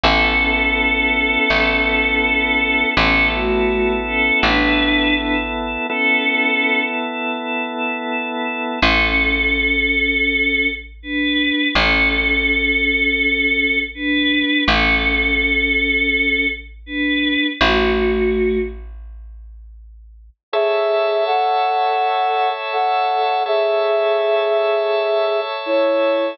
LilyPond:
<<
  \new Staff \with { instrumentName = "Choir Aahs" } { \time 4/4 \key a \major \tempo 4 = 82 <cis' a'>1 | <cis' a'>8 <a fis'>4 <cis' a'>8 <d' b'>4 <d' b'>16 r8. | <cis' a'>4. r2 r8 | <cis' a'>2. <d' b'>4 |
<cis' a'>2. <d' b'>4 | <cis' a'>2. <d' b'>4 | <a fis'>4. r2 r8 | r1 |
r1 | }
  \new Staff \with { instrumentName = "Flute" } { \time 4/4 \key a \major r1 | r1 | r1 | r1 |
r1 | r1 | r1 | <gis' e''>4 <a' fis''>2 <a' fis''>4 |
<gis' e''>2. <e' cis''>4 | }
  \new Staff \with { instrumentName = "Electric Bass (finger)" } { \clef bass \time 4/4 \key a \major a,,2 a,,2 | a,,2 a,,2 | r1 | a,,1 |
a,,1 | a,,1 | a,,1 | r1 |
r1 | }
  \new Staff \with { instrumentName = "Drawbar Organ" } { \time 4/4 \key a \major <b e' a'>1 | <b e' a'>1 | <b e' a'>1 | r1 |
r1 | r1 | r1 | <a' cis'' e''>1 |
<a' cis'' e''>1 | }
>>